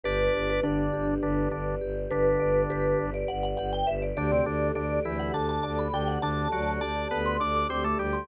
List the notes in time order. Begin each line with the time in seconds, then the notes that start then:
0.04 G1 D4 G4 B4 D5
0.34 G1 B4
0.50 B4
0.63 G1 D3 D4 D5
0.93 G1 G4
1.23 G1 D3 D4 B4
1.51 G1 D3 D4 D5
1.81 G1 G4
2.11 G1 D3 D4 B4
2.40 G1 D5
2.69 G1 G4 B4
2.99 G1 B4
3.14 D5
3.28 G1 D5 F#5
3.43 F#5
3.57 G1 G4 F#5
3.73 G5
3.87 G1 B4 E5
4.02 D5
4.16 D2 D3 D4 G4 D5
4.31 C3 C4
4.45 D2 D3 D4 A4
4.75 D2 D3 D4 D5
5.05 D2 E3 E4 G4
5.19 F#5
5.34 D2 D3 D4 A4 A5
5.49 A5
5.63 D2 D5 A5
5.79 B5
5.92 D2 D3 D4 G4 G5
6.08 F#5
6.21 D2 D3 D4 A4 A5
6.52 D2 F#3 F#4 D5
6.81 D2 D4 G4 D5 A5
7.11 D2 B3 A4 B4
7.26 C6
7.40 D2 D4 D5 D6
7.55 D6
7.69 D2 C4 G4 C5 D6
7.84 A3 A4 D6
7.98 D2 G3 G4 A4 D6
8.13 C6